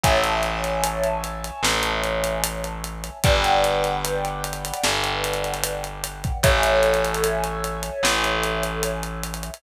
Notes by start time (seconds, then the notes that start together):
0.04 A1 C#5 E5 G#5 A5, kick, closed hi-hat
0.24 closed hi-hat
0.43 closed hi-hat
0.64 closed hi-hat
0.84 closed hi-hat
1.04 closed hi-hat
1.24 closed hi-hat
1.44 closed hi-hat
1.63 A1, snare
1.83 closed hi-hat
2.04 closed hi-hat
2.24 closed hi-hat
2.44 closed hi-hat
2.64 closed hi-hat
2.84 closed hi-hat
3.04 closed hi-hat
3.24 G1 B4 D5 F#5 G5, kick, closed hi-hat
3.44 closed hi-hat
3.64 closed hi-hat
3.84 closed hi-hat
4.05 closed hi-hat
4.25 closed hi-hat
4.44 closed hi-hat
4.53 closed hi-hat
4.65 closed hi-hat
4.74 closed hi-hat
4.83 G1, snare
5.04 closed hi-hat
5.24 closed hi-hat
5.33 closed hi-hat
5.44 closed hi-hat
5.54 closed hi-hat
5.64 closed hi-hat
5.84 closed hi-hat
6.04 closed hi-hat
6.24 kick, closed hi-hat
6.43 A1 A4 C#5 E5 G#5, kick, closed hi-hat
6.63 closed hi-hat
6.83 closed hi-hat
6.94 closed hi-hat
7.05 closed hi-hat
7.15 closed hi-hat
7.24 closed hi-hat
7.44 closed hi-hat
7.64 closed hi-hat
7.83 closed hi-hat
8.03 A1, snare
8.24 closed hi-hat
8.44 closed hi-hat
8.63 closed hi-hat
8.83 closed hi-hat
9.03 closed hi-hat
9.24 closed hi-hat
9.34 closed hi-hat
9.43 closed hi-hat
9.54 closed hi-hat